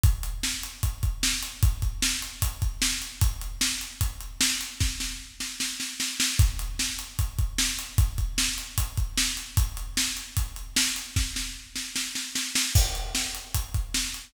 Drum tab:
CC |--------|--------|--------|--------|
HH |xx-xxx-x|xx-xxx-x|xx-xxx-x|--------|
SD |--o---o-|--o---o-|--o---o-|oo-ooooo|
BD |o---oo--|oo--oo--|o---o---|o-------|

CC |--------|--------|--------|--------|
HH |xx-xxx-x|xx-xxx-x|xx-xxx-x|--------|
SD |--o---o-|--o---o-|--o---o-|oo-ooooo|
BD |o---oo--|oo--oo--|o---o---|o-------|

CC |x-------|
HH |-x-xxx-x|
SD |--o---o-|
BD |o---oo--|